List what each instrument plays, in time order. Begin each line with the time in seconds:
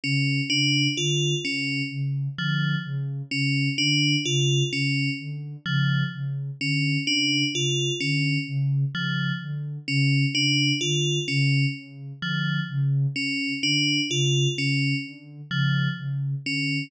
0.04 ocarina C#3, tubular bells C#4
0.50 ocarina C#3, tubular bells D4
0.97 ocarina D3, tubular bells F4
1.44 ocarina C#3, tubular bells C#4
1.91 ocarina C#3
2.38 ocarina D3, tubular bells F3
2.85 ocarina C#3
3.31 ocarina C#3, tubular bells C#4
3.78 ocarina D3, tubular bells D4
4.25 ocarina C#3, tubular bells F4
4.72 ocarina C#3, tubular bells C#4
5.19 ocarina D3
5.66 ocarina C#3, tubular bells F3
6.13 ocarina C#3
6.60 ocarina D3, tubular bells C#4
7.07 ocarina C#3, tubular bells D4
7.54 ocarina C#3, tubular bells F4
8.00 ocarina D3, tubular bells C#4
8.47 ocarina C#3
8.94 ocarina C#3, tubular bells F3
9.41 ocarina D3
9.88 ocarina C#3, tubular bells C#4
10.35 ocarina C#3, tubular bells D4
10.81 ocarina D3, tubular bells F4
11.28 ocarina C#3, tubular bells C#4
11.75 ocarina C#3
12.22 ocarina D3, tubular bells F3
12.69 ocarina C#3
13.16 ocarina C#3, tubular bells C#4
13.63 ocarina D3, tubular bells D4
14.10 ocarina C#3, tubular bells F4
14.57 ocarina C#3, tubular bells C#4
15.04 ocarina D3
15.50 ocarina C#3, tubular bells F3
15.97 ocarina C#3
16.44 ocarina D3, tubular bells C#4